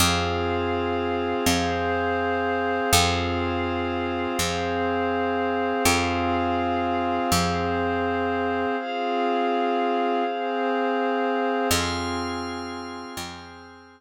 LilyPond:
<<
  \new Staff \with { instrumentName = "Pad 2 (warm)" } { \time 4/4 \key f \minor \tempo 4 = 82 <c' f' aes'>2 <c' aes' c''>2 | <c' f' aes'>2 <c' aes' c''>2 | <c' f' aes'>2 <c' aes' c''>2 | <c' f' aes'>2 <c' aes' c''>2 |
<c' f' aes'>2 <c' aes' c''>2 | }
  \new Staff \with { instrumentName = "Pad 5 (bowed)" } { \time 4/4 \key f \minor <aes' c'' f''>1 | <aes' c'' f''>1 | <aes' c'' f''>1 | <aes' c'' f''>1 |
<aes'' c''' f'''>1 | }
  \new Staff \with { instrumentName = "Electric Bass (finger)" } { \clef bass \time 4/4 \key f \minor f,2 f,2 | f,2 f,2 | f,2 f,2 | r1 |
f,2 f,2 | }
>>